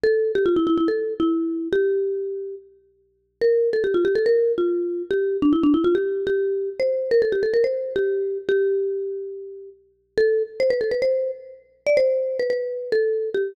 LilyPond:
\new Staff { \time 4/4 \key g \dorian \tempo 4 = 142 a'8. g'16 f'16 e'16 e'16 e'16 a'8. e'4~ e'16 | g'2 r2 | bes'8. a'16 g'16 f'16 g'16 a'16 bes'8. f'4~ f'16 | g'8. d'16 e'16 d'16 e'16 f'16 g'8. g'4~ g'16 |
c''8. bes'16 a'16 g'16 a'16 bes'16 c''8. g'4~ g'16 | g'2. r4 | \key a \dorian a'8. r16 c''16 b'16 a'16 b'16 c''8. r4 r16 | d''16 c''4 b'16 b'4 a'4 g'8 | }